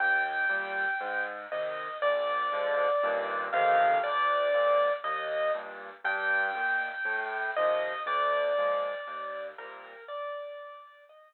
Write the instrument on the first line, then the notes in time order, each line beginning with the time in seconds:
acoustic grand piano
0.00 D#2 G5
0.49 A#2 G3
1.00 G#2
1.52 C3 D#3 D#5
2.02 A#1 D5
2.52 G#2 D3 F3
3.03 D#2 G2 A#2
3.53 A1 F2 C3 D#3 F5
4.03 D2 D5
4.54 F2 G#2 A#2
5.04 D#2 D#5
5.54 G2 A#2
6.04 G2 G5
6.55 A#2 D#3
7.05 A2
7.56 C3 D#3 F3 D#5
8.06 D2 D5
8.58 A#2 F3 G#3
9.07 D#2
9.58 A#2 C3 G3 A#4
10.08 D5
11.09 D#5